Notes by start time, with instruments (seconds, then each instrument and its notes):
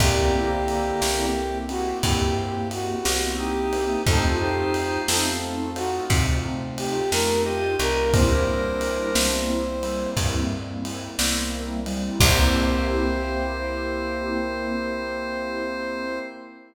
0.00 electric bass (finger) C2, drawbar organ D3 A#3, acoustic grand piano A#3 C4 E4 G4, pad 2 (warm) A#3 C4 E4 G4, brass section G4, kick, ride
0.34 acoustic grand piano A#3 C4 E4 G4
0.68 ride
1.02 electric bass (finger) C2, acoustic grand piano A#3 C4 E4 G4, snare
1.69 acoustic grand piano A#3 C4 E4 G4, brass section F#4, ride
2.03 electric bass (finger) G2, acoustic grand piano A#3 C4 E4 G4, brass section G4, kick, ride
2.71 brass section F#4, ride
3.05 electric bass (finger) C2, acoustic grand piano A#3 C4 E4 G4, snare
3.38 drawbar organ D#4, brass section G4
3.73 acoustic grand piano A#3 C4 E4 G4, ride
4.06 electric bass (finger) F2, pad 2 (warm) A3 C4 D#4 F4, acoustic grand piano A3 C4 D#4 F4, drawbar organ D#4 C5, brass section A4, kick, ride
4.40 acoustic grand piano A3 C4 D#4 F4, brass section G4
4.74 ride
5.08 electric bass (finger) F2, acoustic grand piano A3 C4 D#4 F4, brass section A4, snare
5.76 acoustic grand piano A3 C4 D#4 F4, brass section F#4, ride
6.10 electric bass (finger) C3, acoustic grand piano A3 C4 D#4 F4, kick, ride
6.78 brass section G4, ride
7.12 electric bass (finger) F2, acoustic grand piano A3 C4 D#4 F4, brass section A#4, snare
7.46 brass section G4, drawbar organ G4 D#5
7.79 electric bass (finger) C2, acoustic grand piano A3 C4 D#4 F4, brass section A#4, ride
8.13 pad 2 (warm) G3 A#3 C4 E4, acoustic grand piano G3 A#3 C4 E4, drawbar organ D4 A#4, brass section C5, kick, ride
8.47 acoustic grand piano G3 A#3 C4 E4
8.81 ride
9.15 electric bass (finger) C2, acoustic grand piano G3 A#3 C4 E4, snare
9.83 acoustic grand piano G3 A#3 C4 E4, ride
10.17 electric bass (finger) G2, acoustic grand piano G3 A#3 C4 E4, kick, ride
10.85 ride
11.19 electric bass (finger) C2, acoustic grand piano G3 A#3 C4 E4, snare
11.86 acoustic grand piano G3 A#3 C4 E4, ride
12.20 electric bass (finger) C2, acoustic grand piano A#3 C4 E4 G4, pad 2 (warm) A#3 C4 E4 G4, brass section C5, drawbar organ C5, kick, crash